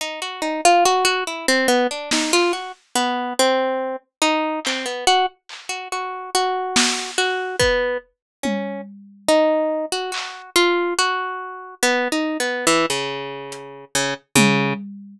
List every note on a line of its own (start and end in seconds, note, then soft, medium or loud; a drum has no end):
0.01 0.20 D#4 medium
0.22 0.41 F#4 medium
0.42 0.61 D#4 medium
0.42 cowbell medium
0.65 0.84 F4 loud
0.85 1.04 F#4 loud
1.05 1.24 F#4 loud
1.27 1.46 E4 medium
1.48 1.67 C4 loud
1.68 1.87 B3 medium
1.91 2.10 D4 medium
2.11 2.32 D#4 medium
2.11 snare medium
2.33 2.52 F4 loud
2.53 2.72 F#4 medium
2.95 3.33 B3 loud
3.39 3.96 C4 loud
4.22 4.60 D#4 loud
4.65 4.86 C4 medium
4.65 clap medium
4.86 5.05 B3 medium
5.07 5.26 F#4 loud
5.49 clap medium
5.69 5.88 F#4 medium
5.92 6.30 F#4 medium
6.35 7.11 F#4 loud
6.76 snare loud
7.18 7.56 F#4 loud
7.60 7.98 B3 medium
7.60 kick medium
8.43 8.81 C#4 medium
8.43 high tom medium
9.29 9.86 D#4 medium
9.92 10.11 F#4 medium
10.12 10.50 F#4 medium
10.12 clap medium
10.56 10.94 F4 loud
10.99 11.75 F#4 loud
11.83 12.08 B3 loud
12.12 12.37 D#4 medium
12.40 12.65 B3 medium
12.67 12.86 E3 loud
12.90 13.85 C#3 medium
13.52 closed hi-hat medium
13.95 14.14 C#3 medium
14.36 14.74 C#3 loud
14.36 high tom loud